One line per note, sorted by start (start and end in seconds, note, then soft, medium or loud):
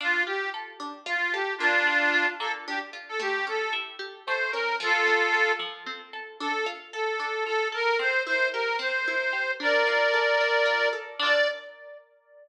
0.00 0.25 D4 medium
0.00 0.23 F4 medium
0.26 0.51 F4 medium
0.26 0.50 G4 medium
0.54 0.78 A4 medium
0.80 1.04 D4 medium
1.06 1.30 F4 medium
1.06 1.32 F4 medium
1.32 1.54 G4 medium
1.32 1.58 A4 medium
1.58 1.84 A#3 medium
1.58 2.26 D4 medium
1.58 2.26 F4 medium
1.87 2.11 D4 medium
2.14 2.38 F4 medium
2.39 2.64 A#3 medium
2.39 2.52 A4 medium
2.67 2.92 D4 medium
2.67 2.79 G4 medium
2.93 3.17 F4 medium
3.08 3.20 A4 medium
3.19 3.43 A3 medium
3.19 3.46 G4 medium
3.47 3.71 C#4 medium
3.47 3.73 A4 medium
3.73 3.97 E4 medium
3.99 4.23 G4 medium
4.26 4.52 A3 medium
4.26 4.51 C5 medium
4.51 4.77 C#4 medium
4.51 4.76 A#4 medium
4.80 5.04 F3 medium
4.80 5.52 F4 medium
4.80 5.52 A4 medium
5.07 5.31 C4 medium
5.34 5.58 A4 medium
5.59 5.83 F3 medium
5.86 6.10 C4 medium
6.13 6.37 A4 medium
6.40 6.64 D4 medium
6.40 6.65 A4 medium
6.66 6.90 F4 medium
6.92 7.44 A4 medium
6.92 7.17 A4 medium
7.20 7.44 D4 medium
7.45 7.70 F4 medium
7.45 7.68 A4 medium
7.72 7.96 A4 medium
7.72 7.97 A#4 medium
7.99 8.23 C4 medium
7.99 8.22 C5 medium
8.26 8.51 E4 medium
8.26 8.48 C5 medium
8.53 8.78 G4 medium
8.53 8.76 A#4 medium
8.79 9.03 C4 medium
8.79 9.51 C5 medium
9.08 9.32 E4 medium
9.33 9.57 G4 medium
9.60 9.84 D4 medium
9.60 10.89 A#4 medium
9.60 10.89 D5 medium
9.87 10.11 F4 medium
10.14 10.38 A4 medium
10.41 10.65 D4 medium
10.65 10.89 F4 medium
10.93 11.17 A4 medium
11.19 11.47 D4 loud
11.19 11.47 F4 medium
11.19 11.48 D5 loud
11.26 11.47 A4 loud